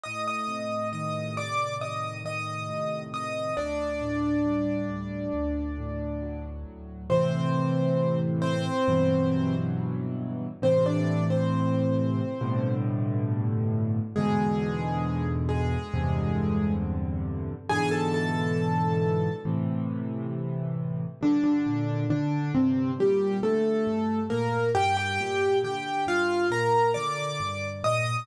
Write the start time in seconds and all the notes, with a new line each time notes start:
0.03 A2 D#5 D#6
0.28 D#5 D#6
0.48 C3
0.93 D#3 D#5 D#6
1.36 A2 D5 D6
1.81 C3 D#5 D#6
2.24 D#3 D#5 D#6
2.69 A2
3.13 C3 D#5 D#6
3.57 D2 D4 D5
4.01 A2
4.46 G3
4.90 D2
5.34 D2
5.78 A2
6.22 F#3
6.66 D2
7.10 A2 C3 E3 C4 C5
8.42 C4 C5
8.88 G2 B2 E3 F#3
10.62 A2 C3 E3 C4 C5
10.86 D4 D5
11.30 C4 C5
12.41 G2 A2 B2 D3
14.16 E2 G#2 B2 D3 G#3 G#4
15.49 G#3 G#4
15.94 E2 G2 C3 D3
17.69 G#2 B2 D3 E3 G#4 G#5
17.91 A4 A5
18.14 A4 A5
19.45 A2 C3 E3
21.21 G2 D3 D4
21.44 D3 D4
21.66 A#2
22.10 D3 D4
22.54 G2 C3 C4
22.98 A#2 G3 G4
23.42 D3 A3 A4
23.87 G2
24.30 A#2 A#3 A#4
24.75 G2 G4 G5
24.97 G4 G5
25.21 A#2
25.64 D3 G4 G5
26.07 G2 F4 F5
26.51 A#2 A#4 A#5
26.94 D3 D5 D6
27.40 G2
27.84 A#2 D#5 D#6